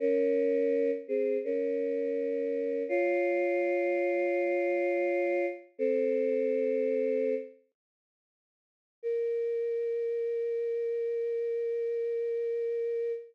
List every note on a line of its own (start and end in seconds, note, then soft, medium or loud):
0.00 0.91 C#4 loud
0.00 0.91 A#4 loud
1.08 1.37 C4 medium
1.08 1.37 G#4 medium
1.44 2.83 C#4 medium
1.44 2.83 A#4 medium
2.89 5.46 F4 loud
2.89 5.46 C#5 loud
5.78 7.35 C4 loud
5.78 7.35 A4 loud
9.03 13.12 A#4 loud